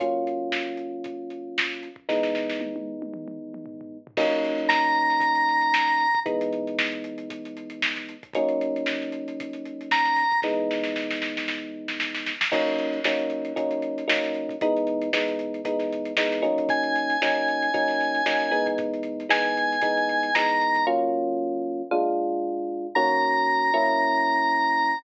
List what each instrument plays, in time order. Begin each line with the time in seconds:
0.00 electric piano 1 F#3 A#3 C#4 F4, kick, closed hi-hat
0.27 closed hi-hat
0.52 snare
0.77 closed hi-hat
1.04 kick, closed hi-hat
1.30 closed hi-hat
1.58 snare
1.70 snare
1.83 closed hi-hat
1.96 kick
2.09 electric piano 1 E3 G#3 B3 D#4, kick, snare
2.23 snare
2.35 snare
2.49 snare
2.61 high tom
2.76 high tom
3.02 high tom
3.14 mid tom
3.28 mid tom
3.54 mid tom
3.66 floor tom
3.81 floor tom
4.07 floor tom
4.17 electric piano 1 F#3 A#3 C#4 D#4, kick, crash
4.32 closed hi-hat
4.45 closed hi-hat
4.58 closed hi-hat
4.69 drawbar organ A#5, snare
4.84 closed hi-hat
4.95 closed hi-hat
5.10 snare, closed hi-hat
5.20 kick, closed hi-hat
5.35 closed hi-hat
5.49 closed hi-hat
5.61 closed hi-hat
5.74 snare
5.87 snare, closed hi-hat
6.00 closed hi-hat
6.15 kick, closed hi-hat
6.26 electric piano 1 E3 G#3 B3 D#4, kick, closed hi-hat
6.41 closed hi-hat
6.53 closed hi-hat
6.67 closed hi-hat
6.78 snare
6.92 closed hi-hat
7.04 closed hi-hat
7.18 closed hi-hat
7.30 kick, closed hi-hat
7.45 closed hi-hat
7.57 closed hi-hat
7.70 closed hi-hat
7.82 snare
7.96 snare, closed hi-hat
8.09 closed hi-hat
8.23 kick, closed hi-hat
8.33 electric piano 1 F#3 A#3 C#4 D#4, kick, closed hi-hat
8.49 closed hi-hat
8.61 closed hi-hat
8.76 closed hi-hat
8.86 snare
9.02 snare, closed hi-hat
9.12 closed hi-hat
9.28 closed hi-hat
9.40 kick, closed hi-hat
9.53 closed hi-hat
9.65 closed hi-hat
9.81 closed hi-hat
9.91 drawbar organ A#5, snare
10.05 snare, closed hi-hat
10.16 snare, closed hi-hat
10.31 kick, closed hi-hat
10.42 electric piano 1 E3 G#3 B3 D#4, kick, snare
10.71 snare
10.83 snare
10.96 snare
11.11 snare
11.22 snare
11.37 snare
11.48 snare
11.88 snare
12.00 snare
12.15 snare
12.26 snare
12.41 snare
12.52 electric piano 1 F#3 A#3 C#4 D#4, kick, crash
12.67 closed hi-hat
12.78 closed hi-hat
12.93 closed hi-hat
13.04 electric piano 1 F#3 A#3 C#4 D#4, snare
13.19 closed hi-hat
13.30 closed hi-hat
13.45 closed hi-hat
13.56 electric piano 1 F#3 A#3 C#4 D#4, kick, closed hi-hat
13.71 closed hi-hat
13.82 closed hi-hat
13.98 closed hi-hat
14.08 electric piano 1 F#3 A#3 C#4 D#4, snare
14.23 snare, closed hi-hat
14.33 snare, closed hi-hat
14.49 kick, closed hi-hat
14.61 electric piano 1 E3 G#3 B3 D#4, kick, closed hi-hat
14.77 closed hi-hat
14.87 closed hi-hat
15.02 closed hi-hat
15.13 electric piano 1 E3 G#3 B3 D#4, snare
15.28 closed hi-hat
15.39 closed hi-hat
15.54 closed hi-hat
15.65 electric piano 1 E3 G#3 B3 D#4, kick, closed hi-hat
15.79 snare, closed hi-hat
15.92 closed hi-hat
16.05 closed hi-hat
16.17 electric piano 1 E3 G#3 B3 D#4, snare
16.32 snare, closed hi-hat
16.42 electric piano 1 F#3 A#3 C#4 D#4, closed hi-hat
16.58 kick, closed hi-hat
16.69 drawbar organ G#5, kick, closed hi-hat
16.83 closed hi-hat
16.96 closed hi-hat
17.10 closed hi-hat
17.22 electric piano 1 F#3 A#3 C#4 D#4, snare
17.35 closed hi-hat
17.48 closed hi-hat
17.62 closed hi-hat
17.74 electric piano 1 F#3 A#3 C#4 D#4, kick, closed hi-hat
17.88 snare, closed hi-hat
18.00 snare, closed hi-hat
18.15 closed hi-hat
18.26 electric piano 1 F#3 A#3 C#4 D#4, snare
18.40 snare, closed hi-hat
18.51 electric piano 1 E3 G#3 B3 D#4, closed hi-hat
18.66 kick, closed hi-hat
18.78 kick, closed hi-hat
18.94 closed hi-hat
19.03 closed hi-hat
19.20 closed hi-hat
19.29 electric piano 1 E3 G#3 B3 D#4, drawbar organ G#5, snare
19.45 snare, closed hi-hat
19.57 closed hi-hat
19.72 closed hi-hat
19.82 electric piano 1 E3 G#3 B3 D#4, kick, closed hi-hat
19.97 closed hi-hat
20.09 closed hi-hat
20.23 closed hi-hat
20.35 electric piano 1 E3 G#3 B3 D#4, drawbar organ A#5, snare
20.48 snare, closed hi-hat
20.61 closed hi-hat
20.75 kick, closed hi-hat
20.87 electric piano 1 F#3 A#3 C#4 F4
21.91 electric piano 1 A#2 G#3 D4 F4
22.95 electric piano 1 D#3 A#3 C#4 F#4, drawbar organ A#5
23.74 electric piano 1 F#3 A#3 C#4 E4